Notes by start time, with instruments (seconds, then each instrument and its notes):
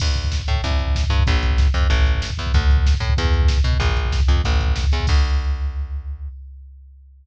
0.00 electric bass (finger) D2, kick, crash
0.08 kick
0.15 kick, closed hi-hat
0.24 kick
0.32 kick, snare
0.39 kick
0.48 electric bass (finger) A2, kick, closed hi-hat
0.56 kick
0.64 electric bass (finger) C2, kick, closed hi-hat
0.71 kick
0.79 kick, closed hi-hat
0.87 kick
0.95 kick, snare
1.04 kick
1.10 electric bass (finger) G2, kick, closed hi-hat
1.19 kick
1.27 electric bass (finger) A#1, kick, closed hi-hat
1.34 kick
1.43 kick, closed hi-hat
1.51 kick
1.58 kick, snare
1.67 kick
1.74 electric bass (finger) F2, kick, closed hi-hat
1.82 kick
1.90 electric bass (finger) A1, kick, closed hi-hat
1.99 kick
2.06 kick, closed hi-hat
2.15 kick
2.22 kick, snare
2.30 kick
2.38 electric bass (finger) E2, kick, closed hi-hat
2.46 kick
2.54 electric bass (finger) D2, kick, closed hi-hat
2.61 kick
2.70 kick, closed hi-hat
2.77 kick
2.86 kick, snare
2.94 kick
3.00 electric bass (finger) A2, kick, closed hi-hat
3.10 kick
3.17 electric bass (finger) E2, kick, closed hi-hat
3.25 kick
3.34 kick, closed hi-hat
3.42 kick
3.48 kick, snare
3.58 kick
3.64 electric bass (finger) B2, kick, closed hi-hat
3.73 kick
3.80 electric bass (finger) A#1, kick, closed hi-hat
3.89 kick
3.97 kick, closed hi-hat
4.05 kick
4.12 kick, snare
4.20 kick
4.28 electric bass (finger) F2, kick, closed hi-hat
4.36 kick
4.44 electric bass (finger) A1, kick, closed hi-hat
4.52 kick
4.60 kick, closed hi-hat
4.68 kick
4.76 kick, snare
4.84 kick
4.92 electric bass (finger) E2, kick, closed hi-hat
5.00 kick
5.07 electric bass (finger) D2, kick, crash